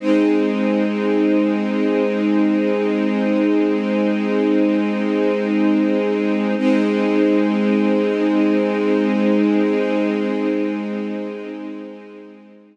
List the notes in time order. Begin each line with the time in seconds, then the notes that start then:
0.00 G#3 C4 D#4
6.58 G#3 C4 D#4